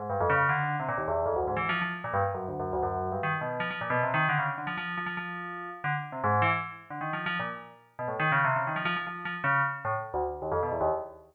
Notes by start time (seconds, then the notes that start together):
0.00 G#2
0.10 G2
0.20 F2
0.30 C#3
0.49 D3
0.80 C3
0.89 A#2
0.98 D#2
1.08 E2
1.26 F2
1.36 D2
1.48 G#2
1.57 E3
1.69 F3
1.82 F3
2.04 A#2
2.14 G2
2.34 F#2
2.48 D2
2.60 F#2
2.73 D2
2.83 F#2
3.12 G2
3.23 D#3
3.41 B2
3.60 F3
3.71 F3
3.81 A#2
3.90 B2
4.03 C3
4.14 D#3
4.29 D3
4.39 C#3
4.58 D3
4.67 F3
4.78 F3
4.97 F3
5.06 F3
5.17 F3
5.84 D3
6.12 C3
6.24 G#2
6.42 E3
6.90 D3
7.01 D#3
7.13 F3
7.26 F3
7.40 A#2
7.99 B2
8.08 A2
8.20 D#3
8.32 C#3
8.45 C3
8.56 C#3
8.67 D#3
8.76 F3
8.85 F3
8.96 F3
9.07 F3
9.25 F3
9.44 C#3
9.85 A2
10.14 D2
10.42 D#2
10.52 F2
10.63 B2
10.72 E2
10.81 D#2